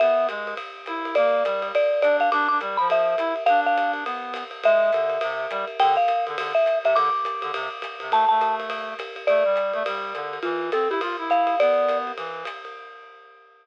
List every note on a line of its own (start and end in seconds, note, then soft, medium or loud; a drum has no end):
0.00 0.28 B3 medium
0.00 0.27 E5 medium
0.00 ride loud
0.29 0.54 G#3 medium
0.29 hi-hat pedal medium
0.29 ride medium
0.47 ride medium
0.57 kick medium
0.57 ride medium
0.86 1.15 E4 medium
0.86 hi-hat pedal medium
0.86 ride medium
1.05 ride medium
1.15 1.43 A#3 medium
1.15 1.68 D5 medium
1.15 ride loud
1.45 1.72 G3 medium
1.45 hi-hat pedal medium
1.45 ride medium
1.62 ride medium
1.75 2.01 D5 medium
1.75 ride medium
2.02 2.30 D4 medium
2.02 2.17 D5 medium
2.02 hi-hat pedal medium
2.02 ride medium
2.20 2.30 F5 medium
2.20 ride medium
2.32 2.48 D4 medium
2.32 2.46 D6 medium
2.32 ride medium
2.48 2.60 D4 medium
2.48 2.58 D6 medium
2.61 2.77 G3 medium
2.61 hi-hat pedal medium
2.61 ride medium
2.77 3.15 F3 medium
2.77 2.88 B5 medium
2.77 ride medium
2.89 3.43 E5 medium
2.89 kick soft
2.89 ride medium
3.18 3.34 E4 medium
3.18 hi-hat pedal medium
3.18 ride medium
3.36 ride medium
3.46 4.04 D4 medium
3.46 3.60 F5 loud
3.46 ride medium
3.66 3.92 F5 medium
3.77 kick medium
3.77 hi-hat pedal medium
3.77 ride medium
3.93 ride medium
4.05 4.44 B3 medium
4.05 ride medium
4.34 hi-hat pedal medium
4.34 ride medium
4.51 ride medium
4.63 4.91 G#3 medium
4.63 5.78 E5 loud
4.63 kick medium
4.63 ride loud
4.92 5.18 D3 medium
4.92 kick medium
4.92 hi-hat pedal medium
4.92 ride medium
5.10 ride medium
5.21 5.47 C3 medium
5.21 ride loud
5.51 5.65 G3 medium
5.51 kick medium
5.51 hi-hat pedal medium
5.51 ride medium
5.68 ride medium
5.80 5.97 D3 medium
5.80 5.95 G5 loud
5.80 ride loud
5.97 6.25 F5 medium
6.08 hi-hat pedal medium
6.08 ride medium
6.27 6.36 D3 medium
6.27 ride medium
6.38 6.53 D3 medium
6.38 ride loud
6.55 6.79 E5 medium
6.66 hi-hat pedal medium
6.66 ride medium
6.84 6.94 C3 medium
6.84 6.96 E5 medium
6.84 ride medium
6.95 7.10 D3 medium
6.95 8.09 D6 loud
6.95 ride loud
7.24 kick medium
7.24 hi-hat pedal medium
7.24 ride medium
7.42 7.51 D3 medium
7.42 ride medium
7.54 7.69 C3 medium
7.54 ride loud
7.82 kick medium
7.82 hi-hat pedal medium
7.82 ride medium
8.00 8.12 C3 medium
8.00 ride medium
8.11 8.25 A3 medium
8.11 8.28 A5 loud
8.11 ride loud
8.29 8.94 A3 medium
8.29 8.55 A5 medium
8.41 hi-hat pedal medium
8.41 ride medium
8.60 ride medium
8.70 ride loud
8.99 kick medium
8.99 hi-hat pedal medium
8.99 ride medium
9.16 ride medium
9.27 9.44 A3 medium
9.27 10.31 D5 medium
9.27 ride medium
9.45 9.73 G3 medium
9.56 hi-hat pedal medium
9.56 ride medium
9.73 9.83 A3 medium
9.73 ride medium
9.86 10.13 G3 medium
9.86 ride loud
10.14 10.39 D3 medium
10.14 hi-hat pedal medium
10.14 ride medium
10.33 ride medium
10.43 10.70 E3 medium
10.43 10.70 F4 medium
10.43 ride medium
10.72 10.88 C4 medium
10.72 10.90 A4 medium
10.72 hi-hat pedal medium
10.72 ride medium
10.90 11.00 E4 medium
10.90 11.01 G4 medium
10.90 ride medium
11.01 11.16 F4 medium
11.01 kick medium
11.01 ride loud
11.18 11.55 E4 medium
11.30 11.59 F5 medium
11.30 hi-hat pedal medium
11.30 ride medium
11.47 ride medium
11.60 12.12 B3 medium
11.60 11.98 D5 medium
11.60 ride loud
11.89 hi-hat pedal medium
11.89 ride medium
12.07 ride medium
12.17 12.44 E3 medium
12.17 kick medium
12.17 ride medium
12.45 hi-hat pedal medium
12.45 ride medium
12.65 ride medium